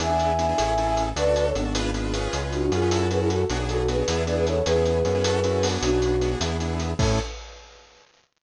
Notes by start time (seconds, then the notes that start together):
0.00 E2 B3 D4 E4 G#4 E5 G#5, closed hi-hat
0.09 B3 D4 E4 G#4
0.19 closed hi-hat
0.39 B3 D4 E4 G#4, closed hi-hat
0.49 B3 D4 E4 G#4
0.58 A1 C#4 E4 G#4 A4, closed hi-hat
0.78 C#4 E4 G#4 A4, closed hi-hat
0.97 closed hi-hat
1.16 D2 D4 F#4 A4 B4 D5, closed hi-hat
1.26 D4 F#4 A4
1.36 B4 D5, closed hi-hat
1.46 A4 C#5
1.55 G#1 B3 D4 F#4 A4, closed hi-hat
1.65 D4 F#4 A4
1.75 D4 F4 G#4 B4, closed hi-hat
1.94 D4 F4 G#4 B4, closed hi-hat
2.13 C#4 F4 G#4 B4, closed hi-hat
2.33 C#2, closed hi-hat
2.42 C#4 F4 G#4 B4
2.52 D4 F#4, closed hi-hat
2.62 D4 F#4
2.72 F#2 C#4 F4 G#4 B4, closed hi-hat
2.82 C#4 F4 G#4 B4
2.91 C#4 E4 F#4 A4, closed hi-hat
3.11 C#4 E4 F#4 G#4 A4 B4, closed hi-hat
3.20 E4 G#4
3.30 F#4 A4, closed hi-hat
3.50 B1 B3 D4 F#4 G#4, closed hi-hat
3.59 B3 D4 F#4 G#4
3.69 F#4 A4, closed hi-hat
3.79 F#4 A4
3.88 B3 D4 F#4 G#4 B4, closed hi-hat
3.98 B3 D4 F#4 G#4
4.08 E2 B3 D4 E4 G#4, closed hi-hat
4.26 B3 D4 E4 G#4 B4 D5, closed hi-hat
4.37 G#4 B4
4.47 A4 C#5, closed hi-hat
4.66 E2 B3 C#4 E4 G#4 B4, closed hi-hat
4.75 B3 C#4 E4 G#4
4.85 closed hi-hat
5.05 F#2 B3 C#4 E4 G#4, closed hi-hat
5.15 B3 C#4 E4 G#4
5.24 C#4 E4 F#4 A4, closed hi-hat
5.44 C#4 E4 F#4 A4, closed hi-hat
5.63 B3 D4 F#4 G#4, open hi-hat
5.82 B1 D4 F#4, closed hi-hat
5.93 B3 D4 F#4 G#4
6.02 closed hi-hat
6.21 B3 D4 F#4 G#4, closed hi-hat
6.31 B3 D4 F#4 G#4
6.40 E2 B3 D4 E4 G#4, closed hi-hat
6.60 B3 D4 E4 G#4, closed hi-hat
6.80 closed hi-hat
6.99 A2 C#4 E4 G#4 A4, kick, crash